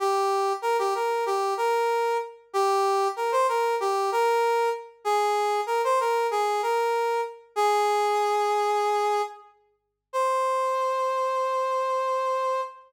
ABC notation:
X:1
M:4/4
L:1/16
Q:1/4=95
K:Cm
V:1 name="Brass Section"
G4 B G B2 G2 B4 z2 | G4 B c B2 G2 B4 z2 | A4 B c B2 A2 B4 z2 | A12 z4 |
c16 |]